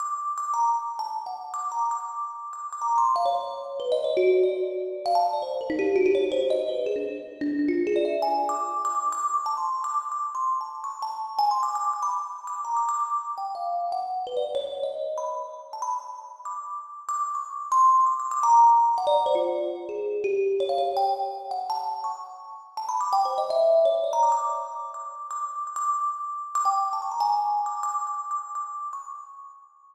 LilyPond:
\new Staff { \time 7/8 \tempo 4 = 166 d'''4 d'''8 ais''16 r4 a''16 r8 | fis''16 r8 d'''8 ais''16 r16 d'''4.~ d'''16 | d'''8 d'''16 ais''8 c'''8 f''16 cis''4. | \tuplet 3/2 { b'8 dis''8 cis''8 } fis'8. d''4.~ d''16 |
f''16 a''8 d''16 c''8 ais'16 dis'16 g'8 fis'16 g'16 cis''8 | c''16 r16 dis''16 r16 b'8 gis'16 d'16 r4 d'8 | d'16 f'8 gis'16 d''16 e''8 gis''8. d'''4 | d'''16 d'''8 d'''16 \tuplet 3/2 { d'''8 cis'''8 a''8 } c'''8. d'''16 d'''8 |
\tuplet 3/2 { d'''4 c'''4 a''4 } cis'''8 a''4 | \tuplet 3/2 { gis''8 c'''8 d'''8 } d'''16 d'''16 d'''16 b''4~ b''16 d'''8 | \tuplet 3/2 { ais''8 d'''8 d'''8 } d'''4 g''8 f''4 | fis''4 b'16 d''16 r16 cis''8. dis''4 |
b''16 r4 r16 a''16 b''4.~ b''16 | d'''4. r16 d'''8. cis'''4 | c'''4 \tuplet 3/2 { d'''8 d'''8 d'''8 } ais''4. | fis''16 d''8 c''16 f'4 r8 gis'4 |
g'4 cis''16 f''16 cis''8 g''8 r4 | fis''8 a''4 cis'''8 r4. | \tuplet 3/2 { a''8 b''8 d'''8 g''8 c''8 dis''8 } e''4 cis''8 | d''16 ais''16 d'''16 d'''8. r4 d'''4 |
d'''4 d'''16 d'''2~ d'''16 | d'''16 g''8. a''16 cis'''16 ais''16 gis''4~ gis''16 d'''8 | \tuplet 3/2 { d'''4 d'''4 d'''4 } d'''4 cis'''8 | }